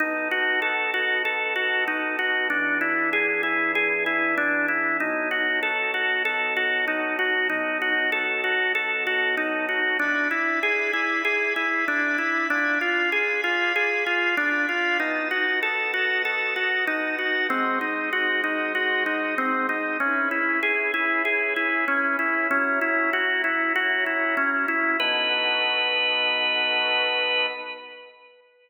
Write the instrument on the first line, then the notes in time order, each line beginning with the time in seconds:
drawbar organ
0.00 B3 D#4 F#4 A4
0.31 F#4
0.62 A4
0.94 F#4
1.25 A4
1.56 F#4
1.88 D#4
2.19 F#4
2.50 E3 B3 D4 G#4
2.81 E4
3.13 G#4
3.43 E4
3.75 G#4
4.06 E4
4.38 D4
4.68 E4
5.00 B2 F#3 D#4 A4
5.31 F#4
5.63 A4
5.94 F#4
6.25 A4
6.57 F#4
6.88 D#4
7.19 F#4
7.49 B2 F#3 D#4 A4
7.82 F#4
8.12 A4
8.44 F#4
8.75 A4
9.07 F#4
9.37 D#4
9.69 F#4
9.99 D4 E4 D5 G#5 B5
10.31 E4
10.63 G#4
10.93 E4
11.25 G#4
11.56 E4
11.88 D4
12.18 E4
12.50 D4 F4 D5 G#5 B5
12.81 F4
13.12 G#4
13.44 F4
13.76 G#4
14.06 F4
14.37 D4
14.69 F4
15.00 B3 D#4 F#4 D#5 A5
15.31 F#4
15.63 A4
15.94 F#4
16.25 A4
16.56 F#4
16.87 D#4
17.18 F#4
17.49 G#3 C4 F#4 C5 D#5
17.81 D#4
18.13 F#4
18.44 D#4
18.75 F#4
19.06 D#4
19.38 C4
19.69 D#4
20.00 C#4 E4 G#4 B4
20.31 E4
20.63 G#4
20.94 E4
21.25 G#4
21.56 E4
21.88 C#4
22.19 E4
22.50 F#3 C#4 E4 A#4
22.81 E4
23.13 F#4
23.44 E4
23.76 F#4
24.06 E4
24.37 C#4
24.68 E4
25.00 B3 D#4 F#4 A4 B4